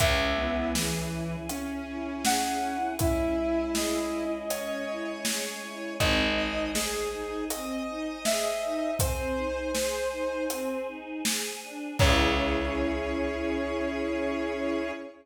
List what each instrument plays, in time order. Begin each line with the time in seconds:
0.00 electric bass (finger) C#2, string ensemble 1 C#4, choir aahs C#4 E4 G#4, flute E5, kick, closed hi-hat
0.38 lead 1 (square) B3, string ensemble 1 E4
0.75 lead 1 (square) E3, string ensemble 1 G#4, snare
1.12 string ensemble 1 E4
1.49 string ensemble 1 C#4, lead 1 (square) C#4, closed hi-hat
1.87 string ensemble 1 E4
2.25 string ensemble 1 G#4, flute F#5, snare
2.62 string ensemble 1 E4
2.99 choir aahs G#3 C#4 G#4, string ensemble 1 C#4, lead 1 (square) E4, flute E5, kick, closed hi-hat
3.38 string ensemble 1 E4
3.75 string ensemble 1 G#4, flute D#5, snare
4.12 string ensemble 1 E4
4.50 string ensemble 1 C#4, lead 1 (square) C#5, closed hi-hat
4.87 string ensemble 1 E4
5.25 string ensemble 1 G#4, snare
5.62 string ensemble 1 E4
6.00 electric bass (finger) G#1, string ensemble 1 C4, choir aahs C5 D#5 G#5, flute D#5, kick, closed hi-hat
6.37 string ensemble 1 D#4, lead 1 (square) D#5
6.75 string ensemble 1 G#4, lead 1 (square) G#4, snare
7.12 string ensemble 1 D#4
7.50 string ensemble 1 C4, lead 1 (square) D#5, closed hi-hat
7.88 string ensemble 1 D#4
8.25 string ensemble 1 G#4, flute E5, snare
8.62 string ensemble 1 D#4
8.99 string ensemble 1 C4, choir aahs G#4 C5 G#5, flute C5, lead 1 (square) C5, kick, closed hi-hat
9.37 string ensemble 1 D#4
9.75 string ensemble 1 G#4, lead 1 (square) C5, snare
10.12 string ensemble 1 D#4
10.50 string ensemble 1 C4, closed hi-hat
10.88 string ensemble 1 D#4
11.25 string ensemble 1 G#4, snare
11.63 string ensemble 1 D4
11.99 electric bass (finger) C#2, choir aahs C#4 E4 G#4, string ensemble 1 C#4 E4 G#4, flute C#5, lead 1 (square) C#5, kick, crash